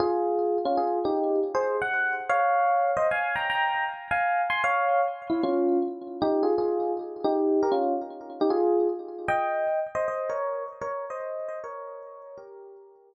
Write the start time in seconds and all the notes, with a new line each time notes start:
0.00 F4 G#4
0.65 C#4 F4
0.77 F4 G#4
1.05 D#4 G4
1.55 G#4 C5
1.82 F#5
2.29 C#5 F5
2.97 C5 D#5
3.11 F5 G#5
3.36 G5 A#5
3.50 G5 A#5
4.11 F5 G#5
4.50 G#5 C6
4.64 C#5 F5
5.30 E4
5.43 C#4 F4
6.22 D#4 G4
6.43 F4 G#4
6.58 F4 G#4
7.24 D#4 G4
7.63 G4 A#4
7.72 C#4 F4
8.41 D#4 G4
8.50 F4 G#4
9.28 D#5 G5
9.95 C5 D#5
10.08 C5 D#5
10.29 A#4 C#5
10.81 A#4 C#5
11.10 C5 D#5
11.48 C5 D#5
11.64 A#4 C#5
12.38 G4 A#4